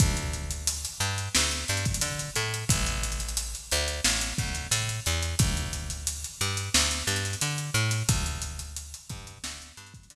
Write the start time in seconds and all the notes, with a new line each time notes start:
0.00 D2, kick, closed hi-hat
0.17 closed hi-hat
0.33 closed hi-hat
0.51 closed hi-hat
0.67 closed hi-hat
0.85 closed hi-hat
1.00 G2, closed hi-hat
1.18 closed hi-hat
1.35 D2, snare
1.51 closed hi-hat
1.68 G2, closed hi-hat
1.77 closed hi-hat
1.85 kick, closed hi-hat
1.94 closed hi-hat
2.01 D3, closed hi-hat
2.19 closed hi-hat
2.36 A2, closed hi-hat
2.54 closed hi-hat
2.69 A1, kick, closed hi-hat
2.86 snare, closed hi-hat
3.03 closed hi-hat
3.12 closed hi-hat
3.20 closed hi-hat
3.29 closed hi-hat
3.37 closed hi-hat
3.55 closed hi-hat
3.71 D2, closed hi-hat
3.88 closed hi-hat
4.04 A1, snare
4.21 closed hi-hat
4.38 D2, kick, closed hi-hat
4.55 closed hi-hat
4.71 A2, closed hi-hat
4.89 closed hi-hat
5.06 E2, closed hi-hat
5.22 closed hi-hat
5.39 D2, kick, closed hi-hat
5.57 closed hi-hat
5.73 closed hi-hat
5.90 closed hi-hat
6.07 closed hi-hat
6.24 closed hi-hat
6.41 G2, closed hi-hat
6.57 closed hi-hat
6.74 D2, snare
6.91 closed hi-hat
7.07 G2, closed hi-hat
7.16 closed hi-hat
7.25 closed hi-hat
7.33 closed hi-hat
7.41 D3, closed hi-hat
7.58 closed hi-hat
7.74 A2, closed hi-hat
7.91 snare, closed hi-hat
8.09 D2, kick, closed hi-hat
8.26 closed hi-hat
8.42 closed hi-hat
8.59 closed hi-hat
8.76 closed hi-hat
8.94 closed hi-hat
9.10 G2, kick, closed hi-hat
9.27 closed hi-hat
9.44 D2, snare
9.62 closed hi-hat
9.77 G2, closed hi-hat
9.87 closed hi-hat
9.94 kick, closed hi-hat
10.03 closed hi-hat
10.10 D3, closed hi-hat